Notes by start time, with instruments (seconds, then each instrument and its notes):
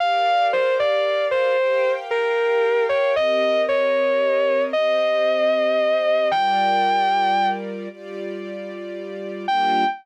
0.00 string ensemble 1 G4 A#4 D5 F5, distortion guitar F5
0.53 distortion guitar C5
0.80 distortion guitar D5
1.31 distortion guitar C5
1.58 string ensemble 1 G4 A#4 F5 G5
2.11 distortion guitar A#4
2.89 distortion guitar C#5
3.16 string ensemble 1 C4 G4 A#4 D#5, distortion guitar D#5
3.69 distortion guitar C#5
4.73 string ensemble 1 C4 G4 C5 D#5, distortion guitar D#5
6.31 string ensemble 1 G3 F4 A#4 D5, distortion guitar G5
7.89 string ensemble 1 G3 F4 G4 D5
9.47 string ensemble 1 G3 A#3 D4 F4, distortion guitar G5